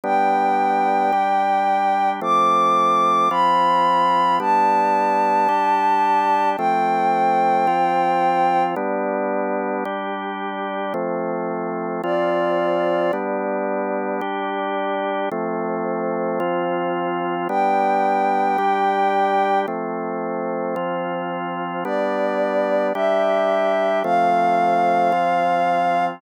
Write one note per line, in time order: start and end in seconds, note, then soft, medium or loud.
0.04 1.12 G3 medium
0.04 1.12 B3 medium
0.04 1.12 D4 medium
0.04 2.09 G5 medium
1.12 2.20 G3 medium
1.12 2.20 D4 medium
1.12 2.20 G4 medium
2.21 3.29 F3 medium
2.21 3.29 A3 medium
2.21 3.29 C4 medium
2.21 3.28 D6 medium
3.30 4.39 F3 medium
3.30 4.39 C4 medium
3.30 4.39 F4 medium
3.30 4.36 B5 medium
4.40 5.48 G3 medium
4.40 5.48 B3 medium
4.40 5.48 D4 medium
4.40 6.49 A5 medium
5.48 6.57 G3 medium
5.48 6.57 D4 medium
5.48 6.57 G4 medium
6.57 7.67 F3 medium
6.57 7.67 A3 medium
6.57 7.67 C4 medium
6.57 8.63 G5 medium
7.67 8.75 F3 medium
7.67 8.75 C4 medium
7.67 8.75 F4 medium
8.76 9.84 G3 loud
8.76 9.84 B3 loud
8.76 9.84 D4 medium
9.85 10.93 G3 medium
9.85 10.93 D4 medium
9.85 10.93 G4 medium
10.94 12.02 F3 medium
10.94 12.02 A3 medium
10.94 12.02 C4 medium
12.03 13.12 F3 medium
12.03 13.12 C4 medium
12.03 13.12 F4 loud
12.03 13.12 D5 medium
13.13 14.21 G3 loud
13.13 14.21 B3 medium
13.13 14.21 D4 medium
14.21 15.29 G3 medium
14.21 15.29 D4 loud
14.21 15.29 G4 medium
15.32 16.39 F3 medium
15.32 16.39 A3 loud
15.32 16.39 C4 medium
16.40 17.48 F3 loud
16.40 17.48 C4 medium
16.40 17.48 F4 medium
17.49 18.57 G3 loud
17.49 18.57 B3 medium
17.49 18.57 D4 medium
17.49 19.58 G5 medium
18.58 19.66 G3 loud
18.58 19.66 D4 medium
18.58 19.66 G4 medium
19.68 20.75 F3 medium
19.68 20.76 A3 medium
19.68 20.75 C4 medium
20.76 21.84 F3 loud
20.76 21.84 C4 medium
20.76 21.84 F4 medium
21.84 22.93 G3 medium
21.84 22.93 B3 medium
21.84 22.93 D4 medium
21.84 22.87 D5 medium
22.94 24.03 G3 medium
22.94 24.03 D4 medium
22.94 24.03 G4 medium
22.94 23.99 E5 medium
24.04 25.12 F3 medium
24.04 25.12 A3 medium
24.04 25.12 C4 medium
24.04 26.05 F5 medium
25.12 26.20 F3 medium
25.12 26.20 C4 medium
25.12 26.20 F4 medium